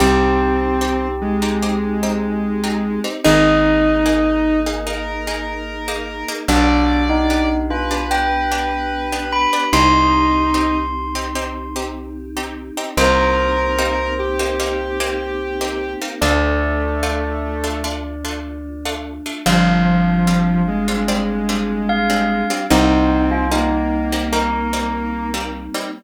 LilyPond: <<
  \new Staff \with { instrumentName = "Tubular Bells" } { \time 4/4 \key c \minor \tempo 4 = 74 g'1 | ees''1 | d'8. ees'8. f'8 g''4. b''8 | c'''2. r4 |
c''1 | d''1 | f''2. f''4 | ees'8. f'16 ees'4 bes'4. r8 | }
  \new Staff \with { instrumentName = "Lead 1 (square)" } { \time 4/4 \key c \minor c'4. aes2~ aes8 | ees'2 bes'2 | d''4. b'2~ b'8 | ees'4. r2 r8 |
bes'4. g'2~ g'8 | a2 r2 | f4. aes2~ aes8 | c'4 bes2~ bes8 r8 | }
  \new Staff \with { instrumentName = "Pizzicato Strings" } { \time 4/4 \key c \minor <c' ees' g'>4 <c' ees' g'>8. <c' ees' g'>16 <c' ees' g'>8 <c' ees' g'>8. <c' ees' g'>8 <c' ees' g'>16 | <bes ees' aes'>4 <bes ees' aes'>8. <bes ees' aes'>16 <bes ees' aes'>8 <bes ees' aes'>8. <bes ees' aes'>8 <bes ees' aes'>16 | <b d' g'>4 <b d' g'>8. <b d' g'>16 <b d' g'>8 <b d' g'>8. <b d' g'>8 <b d' g'>16 | <c' ees' g'>4 <c' ees' g'>8. <c' ees' g'>16 <c' ees' g'>8 <c' ees' g'>8. <c' ees' g'>8 <c' ees' g'>16 |
<bes c' ees' g'>4 <bes c' ees' g'>8. <bes c' ees' g'>16 <bes c' ees' g'>8 <bes c' ees' g'>8. <bes c' ees' g'>8 <bes c' ees' g'>16 | <a d' f'>4 <a d' f'>8. <a d' f'>16 <a d' f'>8 <a d' f'>8. <a d' f'>8 <a d' f'>16 | <g c' d' f'>4 <g c' d' f'>8. <g c' d' f'>16 <g c' d' f'>8 <g c' d' f'>8. <g c' d' f'>8 <g c' d' f'>16 | <g bes c' ees'>4 <g bes c' ees'>8. <g bes c' ees'>16 <g bes c' ees'>8 <g bes c' ees'>8. <g bes c' ees'>8 <g bes c' ees'>16 | }
  \new Staff \with { instrumentName = "Electric Bass (finger)" } { \clef bass \time 4/4 \key c \minor c,1 | aes,,1 | b,,1 | c,1 |
c,1 | d,1 | g,,1 | c,1 | }
  \new Staff \with { instrumentName = "Choir Aahs" } { \time 4/4 \key c \minor <c' ees' g'>1 | <bes ees' aes'>1 | <b d' g'>1 | <c' ees' g'>1 |
<bes c' ees' g'>1 | <a d' f'>1 | <g c' d' f'>1 | <g bes c' ees'>1 | }
>>